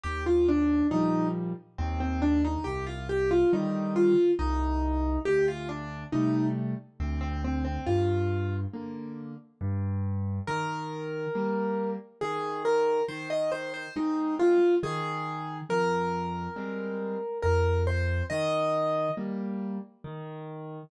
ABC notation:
X:1
M:3/4
L:1/16
Q:1/4=69
K:Eb
V:1 name="Acoustic Grand Piano"
G F D2 E2 z2 C C D E | G F G F E2 F2 E4 | G F D2 E2 z2 C C C C | F4 z8 |
B8 A2 B2 | c e c c E2 F2 A4 | B8 B2 c2 | e4 z8 |]
V:2 name="Acoustic Grand Piano"
E,,4 [B,,F,G,]4 E,,4 | C,,4 [D,E,G,]4 C,,4 | D,,4 [C,G,=A,]4 D,,4 | G,,4 [D,B,]4 G,,4 |
E,4 [G,B,]4 E,4 | E,4 [A,C]4 E,4 | F,,4 [G,A,C]4 F,,4 | E,4 [G,B,]4 E,4 |]